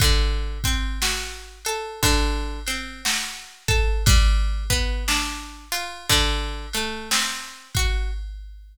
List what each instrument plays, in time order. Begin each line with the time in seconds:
0.00 acoustic guitar (steel) D3, kick, ride
0.64 acoustic guitar (steel) C4, kick, ride
1.02 acoustic guitar (steel) F#4, snare
1.65 acoustic guitar (steel) A4, ride
2.03 acoustic guitar (steel) D3, kick, ride
2.67 acoustic guitar (steel) C4, ride
3.05 acoustic guitar (steel) F#4, snare
3.68 acoustic guitar (steel) A4, kick, ride
4.06 acoustic guitar (steel) G3, kick, ride
4.70 acoustic guitar (steel) B3, kick, ride
5.08 acoustic guitar (steel) D4, snare
5.72 acoustic guitar (steel) F4, ride
6.10 acoustic guitar (steel) D3, kick, ride
6.73 acoustic guitar (steel) A3, ride
7.11 acoustic guitar (steel) C4, snare
7.75 acoustic guitar (steel) F#4, kick, ride